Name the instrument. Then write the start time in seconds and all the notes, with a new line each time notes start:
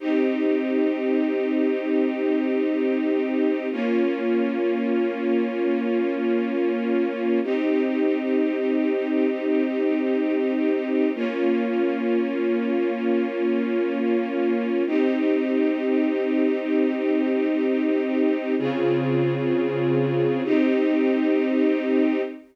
string ensemble 1
0.00 C4 D#4 G4
3.72 A#3 C#4 F4
7.43 C4 D#4 G4
11.15 A#3 C#4 F4
14.87 C4 D#4 G4
18.58 C#3 C4 F4 G#4
20.44 C4 D#4 G4